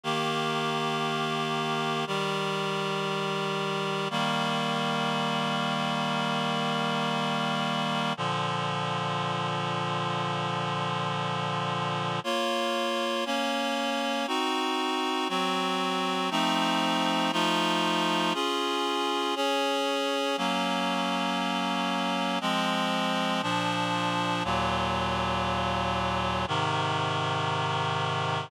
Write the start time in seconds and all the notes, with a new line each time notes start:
0.04 D#3 A#3 G4
2.07 D#3 G3 G4
4.10 D#3 G3 A#3
8.17 A#2 D3 F3
12.24 A#3 F4 C#5
13.26 A#3 C#4 C#5
14.27 C4 D#4 F#4
15.29 F#3 C4 F#4
16.31 F3 A3 C4 D#4
17.32 F3 A3 D#4 F4
18.34 C#4 F4 G#4
19.36 C#4 G#4 C#5
20.37 F#3 A#3 C#4
22.41 F3 G#3 C4
23.43 A#2 F3 D4
24.44 D#2 A#2 F#3
26.48 G#2 C3 D#3